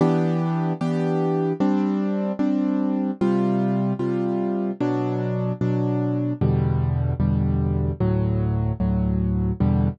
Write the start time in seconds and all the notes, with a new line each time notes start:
0.01 E3 B3 D4 G4
0.81 E3 B3 D4 G4
1.60 G3 C4 D4
2.39 G3 C4 D4
3.21 C3 G3 F4
3.99 C3 G3 F4
4.81 B2 F#3 D4
5.61 B2 F#3 D4
6.41 E2 B2 D3 G3
7.20 E2 B2 D3 G3
8.01 D2 A2 F#3
8.80 D2 A2 F#3
9.60 E2 B2 D3 G3